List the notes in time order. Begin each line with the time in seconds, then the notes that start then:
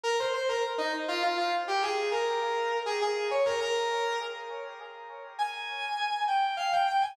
0.04 A#4
0.19 C5
0.33 C5
0.49 A#4
0.78 D#4
1.08 F4
1.23 F4
1.37 F4
1.68 G4
1.82 G#4
2.11 A#4
2.86 G#4
3.01 G#4
3.31 C#5
3.45 A#4
3.60 A#4
5.39 G#5
6.28 G5
6.57 F5
6.73 G5
6.87 G5
7.01 G#5